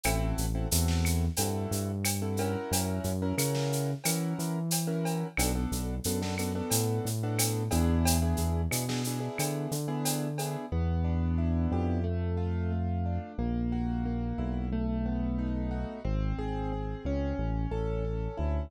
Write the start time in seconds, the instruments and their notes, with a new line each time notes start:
0.03 synth bass 1 A1, acoustic grand piano C4 E4 F#4 A4, cowbell, claves, shaker
0.38 synth bass 1 A1, shaker
0.55 acoustic grand piano C4 E4 F#4 A4
0.71 synth bass 1 E2, acoustic grand piano C4 E4 F#4 A4, shaker
0.88 snare
1.05 claves, shaker
1.37 synth bass 1 G2, acoustic grand piano C4 E4 F#4 A4, cowbell, shaker
1.71 synth bass 1 G2, shaker
2.04 cowbell, claves, shaker
2.22 acoustic grand piano C4 E4 F#4 A4
2.37 acoustic grand piano C#4 E4 F#4 A#4, cowbell, shaker
2.71 synth bass 1 F#2, cowbell, shaker
3.04 synth bass 1 F#2, shaker
3.22 acoustic grand piano C#4 E4 F#4 A#4
3.38 synth bass 1 C#3, acoustic grand piano C#4 E4 F#4 A#4, claves, shaker
3.55 snare
3.73 shaker
4.04 synth bass 1 E3, acoustic grand piano C#4 E4 F#4 A#4, cowbell, claves, shaker
4.39 synth bass 1 E3, shaker
4.71 cowbell, shaker
4.87 acoustic grand piano C#4 E4 F#4 A#4
5.05 cowbell, shaker
5.37 synth bass 1 B1, acoustic grand piano B3 D4 F#4 A4, cowbell, claves, shaker
5.55 acoustic grand piano B3 D4 F#4 A4
5.72 synth bass 1 B1, shaker
6.04 synth bass 1 F#2, acoustic grand piano B3 D4 F#4 A4, shaker
6.21 acoustic grand piano B3 D4 F#4 A4, snare
6.38 acoustic grand piano B3 D4 F#4 A4, claves, shaker
6.55 acoustic grand piano B3 D4 F#4 A4
6.70 synth bass 1 A2, cowbell, shaker
7.05 synth bass 1 A2, shaker
7.23 acoustic grand piano B3 D4 F#4 A4
7.39 cowbell, claves, shaker
7.71 synth bass 1 E2, acoustic grand piano B3 D4 E4 G#4, cowbell, shaker
8.05 cowbell, shaker
8.21 acoustic grand piano B3 D4 E4 G#4
8.37 synth bass 1 E2, shaker
8.71 synth bass 1 B2, acoustic grand piano B3 D4 E4 G#4, claves, shaker
8.88 acoustic grand piano B3 D4 E4 G#4, snare
9.04 acoustic grand piano B3 D4 E4 G#4, shaker
9.20 acoustic grand piano B3 D4 E4 G#4
9.38 synth bass 1 D3, cowbell, claves, shaker
9.71 synth bass 1 D3, shaker
9.88 acoustic grand piano B3 D4 E4 G#4
10.05 cowbell, shaker
10.38 acoustic grand piano B3 D4 E4 G#4, cowbell, shaker
10.72 synth bass 1 E2, acoustic grand piano B3
11.04 acoustic grand piano D4
11.38 acoustic grand piano E4
11.72 synth bass 1 F2, acoustic grand piano G4
12.04 acoustic grand piano A3
12.37 acoustic grand piano F4
12.72 acoustic grand piano A3
13.05 acoustic grand piano D4
13.38 synth bass 1 A#1, acoustic grand piano A#3
13.72 acoustic grand piano F#4
14.05 acoustic grand piano A#3
14.38 synth bass 1 B1, acoustic grand piano E4
14.72 acoustic grand piano A3
15.06 acoustic grand piano B3
15.38 acoustic grand piano D#4
15.71 acoustic grand piano F#4
16.04 synth bass 1 G#1, acoustic grand piano C4
16.38 synth bass 1 G#1, acoustic grand piano G#4
16.72 acoustic grand piano C4
17.05 synth bass 1 C#2, acoustic grand piano C#4
17.38 synth bass 1 A1
17.71 synth bass 1 A1, acoustic grand piano A4
18.04 acoustic grand piano C#4
18.37 synth bass 1 D2, acoustic grand piano E4